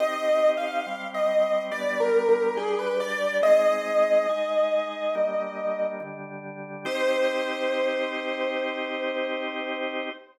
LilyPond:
<<
  \new Staff \with { instrumentName = "Acoustic Grand Piano" } { \time 4/4 \key c \minor \tempo 4 = 70 \tuplet 3/2 { ees''4 f''4 ees''4 d''8 bes'8 bes'8 } aes'16 b'16 d''8 | ees''2. r4 | c''1 | }
  \new Staff \with { instrumentName = "Drawbar Organ" } { \time 4/4 \key c \minor <c' ees' g'>4 <g c' g'>4 <g b d'>4 <g d' g'>4 | <aes c' ees'>4 <aes ees' aes'>4 <g bes d'>4 <d g d'>4 | <c' ees' g'>1 | }
>>